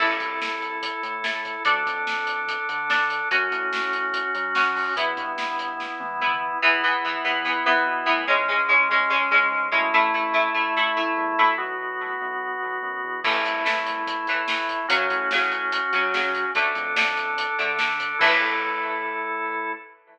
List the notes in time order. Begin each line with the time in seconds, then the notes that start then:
0.00 A1 E4 A4, kick, crash
0.20 C2, kick, closed hi-hat
0.42 snare
0.62 closed hi-hat
0.82 kick, closed hi-hat
1.03 A2, closed hi-hat
1.24 E4 A4, snare
1.45 kick, closed hi-hat
1.65 D2 D4 A4, kick, closed hi-hat
1.86 F2, kick, closed hi-hat
2.07 snare
2.27 closed hi-hat
2.48 kick, closed hi-hat
2.69 D3, closed hi-hat
2.90 D4 A4, snare
3.10 closed hi-hat
3.31 F#2 C#4 F#4, kick, closed hi-hat
3.51 A2, kick, closed hi-hat
3.73 snare
3.93 closed hi-hat
4.13 kick, closed hi-hat
4.35 F#3, closed hi-hat
4.55 C#4 F#4, snare
4.76 kick, open hi-hat
4.96 E2 B3 E4, kick, closed hi-hat
5.17 G2, kick, closed hi-hat
5.38 snare
5.59 closed hi-hat
5.80 kick, snare
6.00 E3, high tom
6.21 B3 E4, mid tom
6.62 E2 E3 B3 E4
6.83 E3 B3
7.05 E3 B3
7.24 E2 E3 B3
7.45 E3 B3
7.65 E2 E3 B3
7.86 B2
8.06 A2 E3 B3
8.27 C#2 G#3 C#4
8.48 G#3 C#4
8.69 G#3 C#4
8.89 C#2 G#3 C#4
9.10 G#3 C#4
9.31 C#2 G#3 C#4
9.51 G#2
9.72 F#2 G#3 A3 C#4 E4
9.94 A1 A3 E4
10.14 A3 E4
10.34 A3 E4
10.54 A1 A3 E4
10.77 A3 E4
10.97 A1 A3 E4
11.17 E2
11.38 D2 A3 E4
11.58 B1 B3 F#4
12.21 B1
12.62 B1
12.83 F#2
13.04 E2
13.24 A1 E3 A3 E4, kick, crash
13.45 C2, kick, closed hi-hat
13.65 E3 A3, snare
13.86 closed hi-hat
14.07 kick, closed hi-hat
14.27 A2 E3 A3, closed hi-hat
14.48 E3 A3, snare
14.69 kick, closed hi-hat
14.88 F#2 C#3 F#3 C#4 F#4, kick, closed hi-hat
15.10 A2, kick, closed hi-hat
15.31 C#3 F#3, snare
15.52 closed hi-hat
15.72 kick, closed hi-hat
15.93 C#3 F#3, closed hi-hat
16.14 C#3 F#3, snare
16.35 kick, closed hi-hat
16.54 D2 D3 A3 D4 A4, kick, closed hi-hat
16.75 F2, kick, closed hi-hat
16.96 D3 A3, snare
17.17 closed hi-hat
17.38 kick, closed hi-hat
17.59 D3 A3, closed hi-hat
17.79 D3 A3, snare
18.00 kick, closed hi-hat
18.19 A2 E3 A3 E4 A4, kick, crash